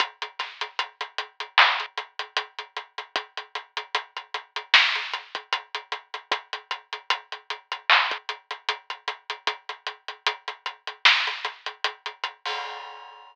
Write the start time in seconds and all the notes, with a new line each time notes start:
0.00 kick, closed hi-hat
0.22 closed hi-hat
0.39 snare, closed hi-hat
0.61 closed hi-hat
0.79 closed hi-hat
1.01 closed hi-hat
1.18 closed hi-hat
1.40 closed hi-hat
1.58 clap
1.80 closed hi-hat
1.98 closed hi-hat
2.19 closed hi-hat
2.37 closed hi-hat
2.59 closed hi-hat
2.76 closed hi-hat
2.98 closed hi-hat
3.16 kick, closed hi-hat
3.37 closed hi-hat
3.55 closed hi-hat
3.77 closed hi-hat
3.95 closed hi-hat
4.17 closed hi-hat
4.34 closed hi-hat
4.56 closed hi-hat
4.74 snare
4.95 closed hi-hat
5.13 closed hi-hat
5.35 kick, closed hi-hat
5.53 closed hi-hat
5.75 closed hi-hat
5.92 closed hi-hat
6.14 closed hi-hat
6.32 kick, closed hi-hat
6.53 closed hi-hat
6.71 closed hi-hat
6.93 closed hi-hat
7.10 closed hi-hat
7.32 closed hi-hat
7.50 closed hi-hat
7.72 closed hi-hat
7.90 clap
8.11 kick, closed hi-hat
8.29 closed hi-hat
8.51 closed hi-hat
8.69 closed hi-hat
8.90 closed hi-hat
9.08 closed hi-hat
9.30 closed hi-hat
9.47 kick, closed hi-hat
9.69 closed hi-hat
9.87 closed hi-hat
10.08 closed hi-hat
10.26 closed hi-hat
10.48 closed hi-hat
10.66 closed hi-hat
10.87 closed hi-hat
11.05 snare
11.27 closed hi-hat
11.45 closed hi-hat
11.66 closed hi-hat
11.84 closed hi-hat
12.06 closed hi-hat
12.24 closed hi-hat
12.46 open hi-hat